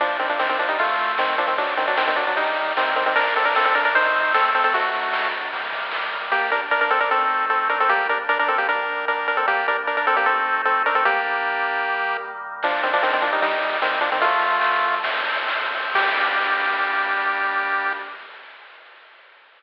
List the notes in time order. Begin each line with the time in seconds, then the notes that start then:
0.00 F3 G3 A#3 D4, kick, ride
0.19 D#3 C4, ride
0.29 F3 D4
0.39 D#3 C4, snare
0.49 D#3 C4
0.59 F3 D4, ride
0.69 G3 D#4
0.79 F3 A3 C4 F4, kick, ride
0.98 ride
1.18 D#3 C4, snare
1.38 F3 D4, ride
1.47 D#3 C4
1.58 B2 F#3 D4, kick, ride
1.77 D#3 C4, ride
1.88 F#3 D4
1.97 D#3 C4, snare
2.07 D#3 C4
2.16 F#3 D4, ride
2.27 F#3 D4
2.37 D#3 G3 A#3 D#4, kick, ride
2.57 kick, ride
2.77 D#3 C4, snare
2.96 D#3 C4, ride
3.06 D#3 C4
3.16 G3 A#3 D4 A#4, kick, ride
3.35 C4 A4, ride
3.45 D4 A#4
3.55 C4 A4, snare
3.65 C4 A4
3.75 D4 A#4, ride
3.85 D4 A#4
3.94 F3 A3 C4 D#4 C5, kick, ride
4.14 ride
4.34 C4 A4, snare
4.54 C4 A4, ride
4.64 C4 A4
4.73 B2 F#3 A3 D4 F#4, kick, ride
4.94 ride
5.13 snare
5.33 ride
5.52 D#3 G3 A#3, kick, ride
5.72 kick, ride
5.91 snare
6.12 ride
6.31 G3 A#3 D4 G4
6.52 D4 A#4
6.71 D4 A#4
6.81 D4 A#4
6.90 C4 A4
7.00 D4 A#4
7.11 A3 C4 D#4 A4
7.50 C4 A4
7.69 D4 A#4
7.80 C4 A4
7.89 G3 A#3 D4 G4
8.09 D4 A#4
8.29 D4 A#4
8.39 D4 A#4
8.48 C4 A4
8.58 A#3 G4
8.69 D#3 G3 A#3 D4 A#4
9.08 D4 A#4
9.28 D4 A#4
9.37 C4 A4
9.48 G3 A#3 D4 G4
9.68 D4 A#4
9.87 D4 A#4
9.97 D4 A#4
10.07 C4 A4
10.16 A#3 G4
10.26 A3 C4 D#4 A4
10.65 C4 A4
10.86 D4 A#4
10.95 C4 A4
11.05 G3 A#3 D4 G4
11.85 D#3 G3 A#3
12.63 F3 G3 A#3 D4, kick, crash
12.83 D#3 C4, ride
12.93 F3 D4
13.03 D#3 C4, snare
13.13 D#3 C4
13.22 F3 D4, ride
13.33 G3 D#4
13.42 D#3 G3 A#3 D#4, kick, ride
13.62 ride
13.82 D#3 C4, snare
14.01 F3 D4, ride
14.12 D#3 C4
14.21 D3 F3 A3 F4, kick, ride
14.41 ride
14.61 snare
14.83 ride
15.04 A2 F3 C4, kick, ride
15.25 kick, ride
15.48 snare
15.71 ride
15.95 G3 A#3 D4 G4, kick, crash